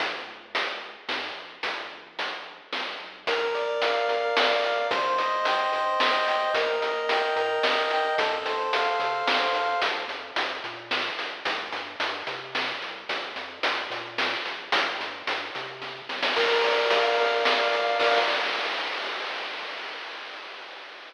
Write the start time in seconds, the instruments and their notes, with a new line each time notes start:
0.00 synth bass 1 A#1, kick, closed hi-hat
0.27 synth bass 1 C#2
0.55 closed hi-hat
1.08 synth bass 1 G#2, snare
1.36 synth bass 1 A#1
1.63 synth bass 1 G1, kick, closed hi-hat
1.92 synth bass 1 A#1
2.19 closed hi-hat
2.72 synth bass 1 C2, snare
3.00 synth bass 1 B1
3.26 synth bass 1 A#1, lead 1 (square) A#4, kick, closed hi-hat
3.55 lead 1 (square) D5, closed hi-hat
3.82 lead 1 (square) F5, closed hi-hat
4.08 synth bass 1 F2, lead 1 (square) A#4, closed hi-hat
4.36 synth bass 1 C#2, lead 1 (square) D5, snare
4.64 lead 1 (square) F5, closed hi-hat
4.90 synth bass 1 C2, lead 1 (square) C5, kick, closed hi-hat
5.18 lead 1 (square) D#5, closed hi-hat
5.45 lead 1 (square) G5, closed hi-hat
5.73 synth bass 1 G2, lead 1 (square) C5, closed hi-hat
6.00 synth bass 1 D#2, lead 1 (square) D#5, snare
6.27 lead 1 (square) G5, closed hi-hat
6.54 synth bass 1 D#2, lead 1 (square) A#4, kick, closed hi-hat
6.81 lead 1 (square) D#5, closed hi-hat
7.09 lead 1 (square) G5, closed hi-hat
7.36 synth bass 1 A#2, lead 1 (square) A#4, closed hi-hat
7.63 synth bass 1 F#2, lead 1 (square) D#5, snare
7.90 lead 1 (square) G5, closed hi-hat
8.18 synth bass 1 F2, lead 1 (square) A4, kick, closed hi-hat
8.45 lead 1 (square) C5, closed hi-hat
8.73 lead 1 (square) F5, closed hi-hat
8.99 synth bass 1 C3, lead 1 (square) A4, closed hi-hat
9.27 synth bass 1 G#2, lead 1 (square) C5, snare
9.55 lead 1 (square) F5, closed hi-hat
9.82 synth bass 1 A#1, kick, closed hi-hat
10.08 synth bass 1 F2, closed hi-hat
10.36 synth bass 1 F2, closed hi-hat
10.64 synth bass 1 A#2, closed hi-hat
10.91 snare
11.19 synth bass 1 A#1, closed hi-hat
11.45 synth bass 1 C2, kick, closed hi-hat
11.73 synth bass 1 G2, closed hi-hat
12.00 synth bass 1 G2, closed hi-hat
12.27 synth bass 1 C3, closed hi-hat
12.55 snare
12.81 synth bass 1 C2, closed hi-hat
13.09 synth bass 1 A#1, kick, closed hi-hat
13.36 synth bass 1 F2, closed hi-hat
13.63 synth bass 1 F2, closed hi-hat
13.90 synth bass 1 A#2, closed hi-hat
14.18 snare
14.46 synth bass 1 A#1, closed hi-hat
14.72 synth bass 1 C2, kick, closed hi-hat
15.00 synth bass 1 G2, closed hi-hat
15.27 synth bass 1 G2, closed hi-hat
15.55 synth bass 1 C3, closed hi-hat
15.82 kick, snare
16.09 synth bass 1 C2, snare
16.23 snare
16.36 synth bass 1 A#1, lead 1 (square) A#4, kick, crash
16.64 lead 1 (square) D5, closed hi-hat
16.90 lead 1 (square) F5, closed hi-hat
17.18 synth bass 1 F2, lead 1 (square) A#4, closed hi-hat
17.45 synth bass 1 C#2, lead 1 (square) D5, snare
17.73 lead 1 (square) F5, closed hi-hat
18.00 synth bass 1 A#1, lead 1 (square) A#4 D5 F5, kick, crash